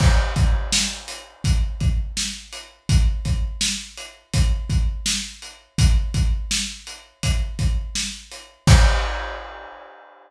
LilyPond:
\new DrumStaff \drummode { \time 4/4 \tempo 4 = 83 <cymc bd>8 <hh bd>8 sn8 hh8 <hh bd>8 <hh bd>8 sn8 hh8 | <hh bd>8 <hh bd>8 sn8 hh8 <hh bd>8 <hh bd>8 sn8 hh8 | <hh bd>8 <hh bd>8 sn8 hh8 <hh bd>8 <hh bd>8 sn8 hh8 | <cymc bd>4 r4 r4 r4 | }